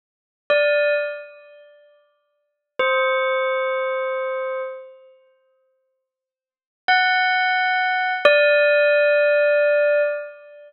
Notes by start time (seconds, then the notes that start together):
0.50 D5
2.79 C5
6.88 F#5
8.25 D5